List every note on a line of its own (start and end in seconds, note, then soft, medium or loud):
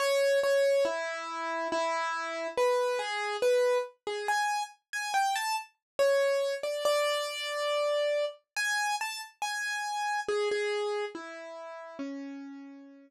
0.00 0.39 C#5 loud
0.43 0.84 C#5 loud
0.85 1.68 E4 loud
1.72 2.47 E4 loud
2.58 2.99 B4 loud
2.99 3.37 G#4 loud
3.42 3.78 B4 loud
4.07 4.27 G#4 medium
4.28 4.63 G#5 loud
4.93 5.13 G#5 loud
5.14 5.34 G5 loud
5.36 5.56 A5 loud
5.99 6.54 C#5 loud
6.63 6.84 D5 medium
6.85 8.25 D5 loud
8.56 8.96 G#5 loud
9.01 9.21 A5 loud
9.42 10.20 G#5 loud
10.28 10.49 G#4 loud
10.51 11.05 G#4 loud
11.15 11.97 E4 medium
11.99 13.08 C#4 loud